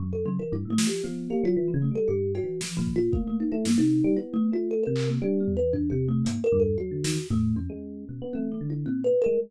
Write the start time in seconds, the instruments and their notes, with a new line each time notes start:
0.00 electric piano 1 F#2
0.13 electric piano 1 F#2, kalimba A4
0.26 electric piano 1 C#3, kalimba F#3
0.39 electric piano 1 E3, kalimba A#4
0.52 electric piano 1 G2, kalimba E4
0.65 electric piano 1 A2
0.70 kalimba A3
0.78 electric piano 1 F3, snare
0.87 kalimba G4
1.04 electric piano 1 F3, kalimba B3
1.30 electric piano 1 A#3, kalimba G4
1.43 electric piano 1 F#3, kalimba F4
1.57 electric piano 1 E3
1.68 kalimba F3
1.74 electric piano 1 C#3
1.82 kalimba A3
1.91 electric piano 1 G3
1.95 kalimba A4
2.08 electric piano 1 G2, kalimba G4
2.35 kalimba F#4, cowbell
2.43 electric piano 1 E3
2.61 kalimba F3, snare
2.77 electric piano 1 A#2, kalimba F3
2.87 kick
2.96 kalimba F4
3.12 kalimba A3, electric piano 1 A#3, kick
3.27 kalimba A3
3.40 kalimba D#4
3.52 electric piano 1 A3, kalimba E4
3.65 electric piano 1 G2, kalimba A#3, snare
3.78 electric piano 1 C3, kalimba D#4
4.04 electric piano 1 G3
4.17 electric piano 1 B3, kalimba E4
4.34 kalimba A3
4.52 electric piano 1 A3, kalimba F4
4.71 kalimba A4
4.83 electric piano 1 C3, kalimba A#4
4.96 clap
5.09 kalimba A#3
5.22 electric piano 1 G3, kalimba D4
5.40 kalimba B3
5.48 floor tom
5.57 electric piano 1 E3, kalimba B4
5.73 kalimba D4, floor tom
5.90 electric piano 1 C3, kalimba G4
6.08 kalimba A3
6.25 electric piano 1 G#2, kalimba A#3, closed hi-hat
6.44 kalimba A#4
6.52 electric piano 1 G2, floor tom
6.60 kalimba A4
6.78 electric piano 1 F#3, kalimba F#4
6.91 electric piano 1 D3
7.04 electric piano 1 D#3, snare
7.30 electric piano 1 A2, kalimba A3, floor tom
7.56 electric piano 1 F2, kalimba C#4
7.70 electric piano 1 G#3
8.09 electric piano 1 B2
8.22 electric piano 1 B3
8.33 electric piano 1 A3, kalimba C4, high tom
8.52 kalimba G#3
8.61 electric piano 1 D3
8.70 kalimba E4
8.86 electric piano 1 A#2, kalimba C4
9.04 kalimba B4
9.22 kalimba A#4
9.26 electric piano 1 G#3